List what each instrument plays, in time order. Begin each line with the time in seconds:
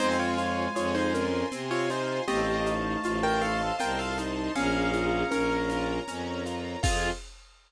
0.00 violin F2, drawbar organ G#3, acoustic grand piano C4 D#4 C5, string ensemble 1 C5 F5 G#5, low conga, shaker
0.19 acoustic grand piano F4 C#5
0.38 acoustic grand piano F4, high conga, shaker
0.75 violin F2, acoustic grand piano F4 G#4 C#5, high conga, shaker
0.95 acoustic grand piano D#4 C5
1.14 acoustic grand piano C#4 F4 A#4, string ensemble 1 C5 G#5 C6, shaker
1.52 violin C3, acoustic grand piano C4, low conga, shaker
1.71 acoustic grand piano F4 C#5
1.90 acoustic grand piano D#4 F4 C5, high conga, shaker
2.28 violin A1, drawbar organ A3, acoustic grand piano C4 G4 D#5, string ensemble 1 C5 D#5 F5 A5, low conga, shaker
2.66 acoustic grand piano D#4, shaker
3.03 violin A1, acoustic grand piano F4, high conga, shaker
3.23 acoustic grand piano A#4 G5
3.41 acoustic grand piano A4 F5, string ensemble 1 C5 D#5 A5 C6, high conga, shaker
3.79 violin C2, acoustic grand piano F4 A#4 G5, low conga, shaker
3.99 acoustic grand piano A4 F5
4.18 acoustic grand piano D#4, high conga, shaker
4.55 violin A#1, drawbar organ C#4, acoustic grand piano C#4 G#4 F5, string ensemble 1 C#5 F5 A#5, low conga, shaker
4.94 acoustic grand piano F4, high conga, shaker
5.31 violin A#1, acoustic grand piano C#4 A#4, high conga, shaker
5.69 acoustic grand piano F4, string ensemble 1 A#4 C#5 A#5, high conga, shaker
6.08 violin F2, acoustic grand piano C#4, low conga, shaker
6.46 acoustic grand piano F4, shaker
6.83 violin F2, string ensemble 1 C4 F4 G#4, acoustic grand piano C4 F4 G#4, drawbar organ F4, kick, crash